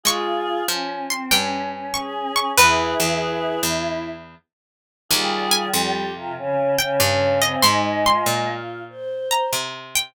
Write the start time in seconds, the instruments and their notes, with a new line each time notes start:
0.03 harpsichord G#3 C#6, choir aahs F4 G#4
0.68 harpsichord F3, choir aahs C#4
1.10 choir aahs C4, harpsichord C6
1.30 harpsichord G2 G5, choir aahs C#4
1.71 choir aahs C#4
1.94 choir aahs G#4, harpsichord C#6
2.36 harpsichord C#6
2.58 harpsichord E2 B4, choir aahs E4 G#4 B4
3.00 harpsichord E2
3.21 choir aahs E4
3.63 harpsichord E2
5.09 harpsichord D#2 G#5, choir aahs G3 F4 G#4
5.51 harpsichord G#5
5.73 harpsichord F2, choir aahs G4
6.13 choir aahs C3 F4
6.37 choir aahs C#3 C#4
6.78 choir aahs C#3 C#4, harpsichord G5
7.00 harpsichord G2, choir aahs C#4
7.42 choir aahs C4, harpsichord D#5
7.62 harpsichord G#2 C6, choir aahs G#3 D#4
8.05 choir aahs F4, harpsichord C6
8.26 harpsichord A#2
8.89 choir aahs C5
9.31 harpsichord A#5
9.53 harpsichord C3
9.95 harpsichord G5